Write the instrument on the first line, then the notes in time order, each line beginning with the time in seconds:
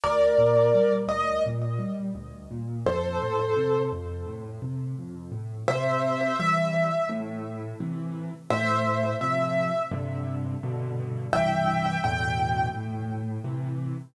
acoustic grand piano
0.03 D2 A#4 D5
0.38 A#2
0.74 G3
1.08 D2 D#5
1.46 A#2
1.79 G3
2.15 D2
2.51 A#2
2.86 F2 A4 C5
3.22 A2
3.56 C3
3.92 F2
4.26 A2
4.62 C3
4.98 F2
5.32 A2
5.68 C3 C5 E5
6.39 E3 G3 E5
7.09 A2
7.80 C3 E3
8.50 A2 C5 E5
9.21 C3 F3 E5
9.91 G2 C3 D3
10.63 G2 B2 D3
11.33 C2 G2 E3 E5 G5
12.04 E2 A2 B2 D3 G5
12.74 A2
13.44 C3 E3